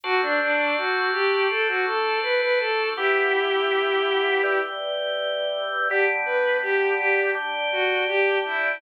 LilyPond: <<
  \new Staff \with { instrumentName = "Violin" } { \time 4/4 \key g \major \tempo 4 = 82 fis'16 d'16 d'8 fis'8 g'8 a'16 fis'16 a'8 b'16 b'16 a'8 | <e' g'>2~ <e' g'>8 r4. | g'16 r16 b'8 g'8 g'8 r8 fis'8 g'8 e'8 | }
  \new Staff \with { instrumentName = "Drawbar Organ" } { \time 4/4 \key g \major <d' fis' a' c''>1 | <e b g'>2 <e g g'>2 | <g b d'>2 <g d' g'>2 | }
>>